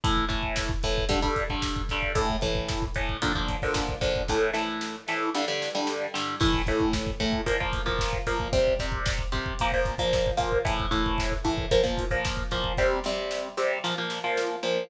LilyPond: <<
  \new Staff \with { instrumentName = "Overdriven Guitar" } { \time 4/4 \key a \phrygian \tempo 4 = 113 <a, e a>8 <a, e a>4 <a, e a>8 <g, d g>16 <g, d g>8 <g, d g>8. <g, d g>8 | <a, e a>8 <a, e a>4 <a, e a>8 <bes, d f>16 <bes, d f>8 <bes, d f>8. <bes, d f>8 | <a, e a>8 <a, e a>4 <a, e a>8 <g, d g>16 <g, d g>8 <g, d g>8. <g, d g>8 | <a, e a>8 <a, e a>4 <a, e a>8 <bes, f bes>16 <bes, f bes>8 <bes, f bes>8. <bes, f bes>8 |
<c g c'>8 <c g c'>4 <c g c'>8 <bes, f bes>16 <bes, f bes>8 <bes, f bes>8. <bes, f bes>8 | <a, e a>8 <a, e a>4 <a, e a>8 <bes, f bes>16 <bes, f bes>8 <bes, f bes>8. <bes, f bes>8 | <c g c'>8 <c g c'>4 <c g c'>8 <bes, f bes>16 <bes, f bes>8 <bes, f bes>8. <bes, f bes>8 | }
  \new DrumStaff \with { instrumentName = "Drums" } \drummode { \time 4/4 <hh bd>16 bd16 <hh bd>16 bd16 <bd sn>16 bd16 <hh bd>16 bd16 <hh bd>16 bd16 <hh bd>16 bd16 <bd sn>16 bd16 <hh bd sn>16 bd16 | <hh bd>16 bd16 <hh bd>16 bd16 <bd sn>16 bd16 <hh bd>16 bd16 <hh bd>16 bd16 <hh bd>16 bd16 <bd sn>16 bd16 <hh bd sn>16 bd16 | <bd sn>8 sn8 sn8 sn8 sn8 sn8 sn8 sn8 | <cymc bd>16 bd16 <hh bd>16 bd16 <bd sn>16 bd16 <hh bd>16 bd16 <hh bd>16 bd16 <hh bd>16 bd16 <bd sn>16 bd16 <hh bd sn>16 bd16 |
<hh bd>16 bd16 <hh bd>16 bd16 <bd sn>16 bd16 <hh bd>16 bd16 <hh bd>16 bd16 <hh bd>16 bd16 <bd sn>16 bd16 <hh bd sn>16 bd16 | <hh bd>16 bd16 <hh bd>16 bd16 <bd sn>16 bd16 <hh bd>16 bd16 <hh bd>16 bd16 <hh bd>16 bd16 <bd sn>16 bd16 <hh bd sn>16 bd16 | <bd sn>8 sn8 sn8 sn8 sn8 sn8 sn4 | }
>>